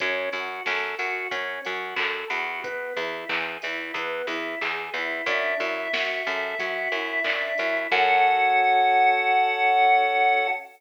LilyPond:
<<
  \new Staff \with { instrumentName = "Lead 1 (square)" } { \time 4/4 \key fis \minor \tempo 4 = 91 r1 | r1 | e''1 | fis''1 | }
  \new Staff \with { instrumentName = "Drawbar Organ" } { \time 4/4 \key fis \minor cis'8 fis'8 a'8 fis'8 cis'8 fis'8 a'8 fis'8 | b8 e'8 gis'8 e'8 b8 e'8 gis'8 e'8 | d'8 e'8 fis'8 a'8 fis'8 e'8 d'8 e'8 | <cis' fis' a'>1 | }
  \new Staff \with { instrumentName = "Electric Bass (finger)" } { \clef bass \time 4/4 \key fis \minor fis,8 fis,8 fis,8 fis,8 fis,8 fis,8 fis,8 e,8~ | e,8 e,8 e,8 e,8 e,8 e,8 e,8 e,8 | fis,8 fis,8 fis,8 fis,8 fis,8 fis,8 fis,8 fis,8 | fis,1 | }
  \new DrumStaff \with { instrumentName = "Drums" } \drummode { \time 4/4 <hh bd>8 hho8 <bd sn>8 hho8 <hh bd>8 hho8 <hc bd>8 hho8 | <hh bd>8 hho8 <hc bd>8 hho8 <hh bd>8 hho8 <hc bd>8 hho8 | <hh bd>8 hho8 <bd sn>8 hho8 <hh bd>8 hho8 <hc bd>8 hho8 | <cymc bd>4 r4 r4 r4 | }
>>